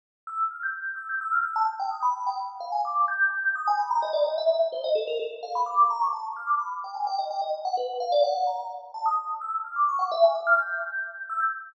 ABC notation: X:1
M:5/8
L:1/16
Q:1/4=128
K:none
V:1 name="Electric Piano 2"
z2 e' z f' g'3 e' g' | e' f' e' a z g ^d' b2 g | z2 f ^g d'2 =g'4 | ^d' ^g b ^a ^d =d ^d e2 z |
c ^d A ^A =A z f b =d'2 | ^a ^c' =a z f' d' b z g ^g | g ^d g d z ^f B2 =f =d | ^f2 ^a2 z2 =a ^d'2 z |
e' z f' d' ^c' ^f e ^g d' =f' | g'6 e' g'2 z |]